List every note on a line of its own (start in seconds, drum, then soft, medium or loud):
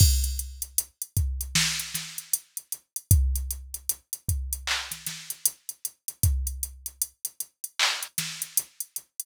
0.00 kick loud
0.00 crash loud
0.24 closed hi-hat medium
0.39 closed hi-hat medium
0.62 closed hi-hat medium
0.78 closed hi-hat loud
1.02 closed hi-hat medium
1.17 kick loud
1.17 closed hi-hat medium
1.41 closed hi-hat medium
1.55 snare loud
1.80 closed hi-hat medium
1.94 snare medium
1.94 closed hi-hat medium
2.18 closed hi-hat medium
2.33 closed hi-hat loud
2.57 closed hi-hat medium
2.72 closed hi-hat medium
2.96 closed hi-hat medium
3.11 kick loud
3.11 closed hi-hat loud
3.36 closed hi-hat medium
3.51 closed hi-hat medium
3.74 closed hi-hat medium
3.89 closed hi-hat loud
4.13 closed hi-hat medium
4.29 kick medium
4.29 closed hi-hat medium
4.53 closed hi-hat loud
4.67 clap loud
4.91 snare soft
4.91 closed hi-hat medium
5.06 snare medium
5.06 closed hi-hat medium
5.30 closed hi-hat medium
5.45 closed hi-hat loud
5.69 closed hi-hat medium
5.85 closed hi-hat medium
6.08 closed hi-hat medium
6.23 kick loud
6.23 closed hi-hat loud
6.47 closed hi-hat medium
6.63 closed hi-hat loud
6.86 closed hi-hat medium
7.02 closed hi-hat loud
7.25 closed hi-hat medium
7.40 closed hi-hat medium
7.64 closed hi-hat medium
7.79 clap loud
8.03 closed hi-hat medium
8.18 snare medium
8.18 closed hi-hat loud
8.42 closed hi-hat medium
8.57 closed hi-hat loud
8.80 closed hi-hat medium
8.96 closed hi-hat medium
9.20 closed hi-hat medium